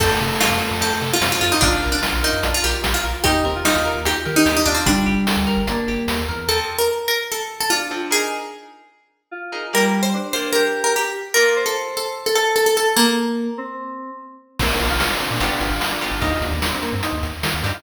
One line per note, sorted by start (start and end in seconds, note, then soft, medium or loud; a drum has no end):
0.00 0.09 F2 medium
0.00 1.09 A3 medium
0.00 0.18 C4 medium
0.00 0.36 A4 medium
0.00 kick medium
0.00 crash medium
0.20 0.30 C3 medium
0.20 0.38 A4 medium
0.40 0.58 F4 medium
0.40 0.76 F4 medium
0.40 snare loud
0.51 0.60 F2 medium
0.61 0.79 A4 medium
0.71 0.80 F2 medium
0.81 0.90 F2 medium
0.81 0.99 C4 medium
0.81 0.92 A4 medium
0.81 closed hi-hat medium
1.01 1.11 C3 medium
1.01 1.20 A4 medium
1.01 snare soft
1.13 1.32 F4 medium
1.21 1.30 F2 medium
1.21 1.57 C4 medium
1.21 1.40 F4 medium
1.21 snare loud
1.32 1.41 F4 medium
1.41 1.51 F2 medium
1.41 1.51 F4 medium
1.41 1.60 A4 medium
1.52 1.61 D#4 medium
1.61 1.71 A#1 medium
1.61 1.87 D4 medium
1.61 1.81 D4 medium
1.61 2.54 F4 loud
1.61 kick medium
1.61 closed hi-hat medium
1.82 1.92 A#1 medium
1.82 2.01 A#4 medium
1.92 2.22 D4 medium
2.03 2.22 F4 medium
2.03 snare medium
2.13 2.22 A#1 medium
2.23 2.52 D#4 medium
2.23 2.41 A#4 medium
2.32 2.42 F2 medium
2.43 2.52 A#1 medium
2.43 2.61 D4 medium
2.43 closed hi-hat medium
2.54 2.64 F4 medium
2.63 2.73 A#1 medium
2.63 2.82 G4 medium
2.63 2.81 A#4 medium
2.63 snare soft
2.84 2.93 A#1 medium
2.84 3.02 F4 medium
2.84 snare medium
2.94 3.04 F4 medium
3.04 3.13 A#1 medium
3.04 3.23 A#4 medium
3.24 3.34 D#2 medium
3.24 3.42 D#4 medium
3.24 3.43 D#4 loud
3.24 3.60 G4 medium
3.24 kick medium
3.24 closed hi-hat medium
3.45 3.54 D#2 medium
3.45 3.54 C4 medium
3.45 3.63 A#4 medium
3.55 3.64 F4 medium
3.65 4.00 D#4 medium
3.65 3.74 F4 medium
3.65 3.84 G4 medium
3.65 snare medium
3.75 3.85 D#2 medium
3.75 4.00 F4 medium
3.85 4.03 A#4 medium
3.95 4.04 D#2 medium
4.05 4.14 D#2 medium
4.05 4.24 D#4 medium
4.05 4.54 G4 medium
4.05 4.16 G4 medium
4.05 closed hi-hat medium
4.25 4.35 D#3 medium
4.25 4.44 A#4 medium
4.25 snare soft
4.36 4.52 D#4 medium
4.46 4.55 D#2 medium
4.46 4.64 G4 medium
4.46 snare medium
4.57 4.66 D#4 medium
4.66 4.75 D#2 medium
4.66 4.75 D4 medium
4.66 5.05 D4 loud
4.66 4.85 F4 medium
4.75 4.84 C4 medium
4.85 4.95 G1 medium
4.85 5.60 G3 loud
4.85 5.36 D4 medium
4.85 kick medium
4.85 closed hi-hat medium
5.06 5.16 G1 medium
5.06 5.24 G4 medium
5.27 5.46 A4 medium
5.27 snare medium
5.36 5.46 D2 medium
5.47 5.65 A#4 medium
5.57 5.66 G1 medium
5.67 5.76 G1 medium
5.67 6.19 A#3 medium
5.67 5.85 D4 medium
5.67 closed hi-hat medium
5.88 5.97 G1 medium
5.88 6.06 G4 medium
5.88 snare soft
6.07 6.26 D#2 medium
6.07 6.26 A4 medium
6.07 snare medium
6.28 6.47 E2 medium
6.28 6.47 A#4 medium
6.48 6.77 F3 medium
6.48 6.77 C4 medium
6.48 6.77 A4 medium
6.48 6.58 A4 medium
6.78 7.03 A#4 medium
7.08 7.27 A#4 medium
7.32 7.60 A4 medium
7.60 7.70 A4 medium
7.70 8.09 D4 medium
7.70 8.09 F4 medium
7.91 8.05 F3 medium
7.91 8.05 C4 medium
7.91 8.05 A4 medium
8.11 8.39 D#4 medium
8.11 8.39 G#4 medium
8.11 8.92 G#4 loud
8.11 8.39 A#4 medium
9.31 9.64 F4 medium
9.52 9.66 D#4 medium
9.52 9.66 G#4 medium
9.52 9.66 A#4 medium
9.73 10.12 G3 loud
9.73 10.02 A#3 medium
9.73 10.02 G4 medium
9.73 9.84 A#4 medium
9.73 10.02 D5 medium
10.03 10.29 C5 medium
10.14 10.51 D4 medium
10.33 10.62 A#3 medium
10.33 10.62 G4 medium
10.33 10.50 C5 medium
10.33 10.62 D5 medium
10.53 11.07 G4 medium
10.53 10.79 A#4 medium
10.84 10.94 A#4 medium
10.96 11.35 G4 medium
11.34 11.64 A#3 medium
11.34 11.64 F4 medium
11.34 11.61 A#4 medium
11.34 11.54 A#4 medium
11.34 11.64 D5 medium
11.56 12.14 C5 medium
11.66 11.94 A4 medium
11.97 12.23 A4 medium
12.26 12.35 A4 medium
12.35 12.53 A4 medium
12.46 12.74 A4 medium
12.56 12.65 A4 medium
12.66 12.76 A4 medium
12.77 12.93 A4 medium
12.77 12.95 A4 medium
12.96 13.51 A#3 loud
12.96 13.47 A#3 medium
13.58 14.10 C4 medium
14.59 14.68 A#1 medium
14.59 14.88 A#3 medium
14.59 14.70 C4 medium
14.59 14.88 C4 medium
14.59 14.88 F4 medium
14.59 kick medium
14.59 crash medium
14.70 14.80 D4 medium
14.80 14.89 A#1 medium
14.80 14.89 F4 medium
14.80 closed hi-hat medium
14.90 14.99 A#1 medium
14.90 15.07 F4 medium
15.00 snare medium
15.09 15.19 D4 medium
15.20 15.30 C4 medium
15.20 closed hi-hat medium
15.31 15.40 A#2 medium
15.31 15.40 D4 medium
15.40 15.49 G1 medium
15.40 15.69 B3 medium
15.40 15.69 D4 medium
15.40 15.69 F4 medium
15.40 15.51 F4 medium
15.40 15.69 G4 medium
15.40 closed hi-hat medium
15.50 15.60 D4 medium
15.60 15.70 G1 medium
15.60 15.85 F4 medium
15.60 closed hi-hat medium
15.70 15.79 G1 medium
15.81 snare medium
15.91 16.10 D4 medium
16.01 16.16 B3 medium
16.01 16.16 D4 medium
16.01 16.16 F4 medium
16.01 16.16 G4 medium
16.01 snare soft
16.01 closed hi-hat medium
16.11 16.20 G1 medium
16.11 16.22 F4 medium
16.21 16.31 D#2 medium
16.21 16.50 C4 medium
16.21 16.31 D#4 medium
16.21 16.50 D#4 medium
16.21 16.50 G4 medium
16.21 kick medium
16.21 closed hi-hat medium
16.32 16.41 F4 medium
16.41 16.51 D#2 medium
16.41 16.61 D4 medium
16.41 closed hi-hat medium
16.51 16.60 D#2 medium
16.62 16.72 D4 medium
16.62 snare medium
16.73 16.82 C4 medium
16.82 16.92 A#3 medium
16.82 closed hi-hat medium
16.92 17.02 G2 medium
16.92 17.02 C4 medium
17.03 17.13 D#4 medium
17.03 closed hi-hat medium
17.13 17.22 D#2 medium
17.23 17.32 D#2 medium
17.23 closed hi-hat medium
17.43 17.52 D#3 medium
17.43 17.53 F4 medium
17.43 snare medium
17.54 17.63 D#2 medium
17.63 17.72 G2 medium
17.63 17.78 C4 medium
17.63 17.73 D4 medium
17.63 17.78 D#4 medium
17.63 17.78 G4 medium
17.63 snare soft
17.63 open hi-hat medium
17.74 17.83 F4 medium